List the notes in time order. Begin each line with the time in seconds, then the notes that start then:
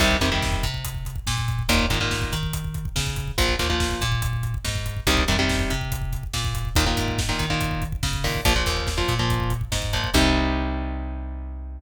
0.00 C2 C3 D#3 G3, kick, crash
0.11 kick
0.21 F2 C3 D#3 G3, kick, closed hi-hat
0.32 C3 D#3 G3, kick
0.42 kick, snare
0.52 kick
0.63 C3, kick, closed hi-hat
0.74 kick
0.85 kick, closed hi-hat
0.95 kick
1.05 kick, closed hi-hat
1.16 kick
1.27 A#2, kick, snare
1.38 kick
1.48 kick, closed hi-hat
1.59 kick
1.69 D#2 A#2 D#3, kick, closed hi-hat
1.79 kick
1.90 G#2 A#2 D#3, kick, closed hi-hat
2.01 A#2 D#3, kick
2.11 kick, snare
2.22 kick
2.32 D#3, kick, closed hi-hat
2.43 kick
2.53 kick, closed hi-hat
2.64 kick
2.74 kick, closed hi-hat
2.85 kick
2.96 C#3, kick, snare
3.07 kick
3.16 kick, closed hi-hat
3.28 kick
3.38 A#1 A#2 F3, kick, closed hi-hat
3.49 kick
3.59 D#2 A#2 F3, kick, closed hi-hat
3.70 A#2 F3, kick
3.80 kick, snare
3.91 kick
4.01 A#2, kick, closed hi-hat
4.12 kick
4.22 kick, closed hi-hat
4.33 kick
4.43 kick, closed hi-hat
4.54 kick
4.65 G#2, kick, snare
4.75 kick
4.86 kick, closed hi-hat
4.97 kick
5.07 C2 C3 D#3 G3, kick, closed hi-hat
5.17 kick
5.28 F2 C3 D#3 G3, kick, closed hi-hat
5.39 C3 D#3 G3, kick
5.49 kick, snare
5.59 kick
5.70 C3, kick, closed hi-hat
5.81 kick
5.92 kick, closed hi-hat
6.02 kick
6.12 kick, closed hi-hat
6.23 kick
6.33 A#2, kick, snare
6.45 kick
6.55 kick, closed hi-hat
6.65 kick
6.75 D#2 A#2 D#3, kick, closed hi-hat
6.86 A#2 D#3, kick
6.97 G#2, kick, closed hi-hat
7.08 kick
7.18 kick, snare
7.29 A#2 D#3, kick
7.39 D#3, kick, closed hi-hat
7.50 A#2 D#3, kick
7.61 kick, closed hi-hat
7.71 kick
7.82 kick, closed hi-hat
7.92 kick
8.03 C#3, kick, snare
8.13 kick
8.24 A#2 D#3, kick, open hi-hat
8.34 kick
8.45 A#1 A#2 F3, kick, closed hi-hat
8.56 A#2 F3, kick
8.66 D#2, kick, closed hi-hat
8.77 kick
8.87 kick, snare
8.98 A#2 F3, kick
9.08 A#2, kick, closed hi-hat
9.19 A#2 F3, kick
9.30 kick, closed hi-hat
9.40 kick
9.50 kick, closed hi-hat
9.61 kick
9.72 G#2, kick, snare
9.82 kick
9.93 A#2 F3, kick, closed hi-hat
10.04 kick
10.14 C2 C3 D#3 G3, kick, crash